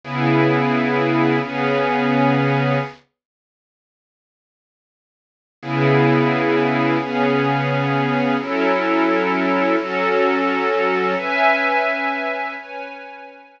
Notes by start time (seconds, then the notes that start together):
0.01 C#3 B3 E4 G#4
1.40 C#3 B3 C#4 G#4
5.59 C#3 B3 E4 G#4
6.98 C#3 B3 C#4 G#4
8.38 F#3 C#4 E4 A4
9.76 F#3 C#4 F#4 A4
11.17 C#4 B4 E5 G#5
12.55 C#4 B4 C#5 G#5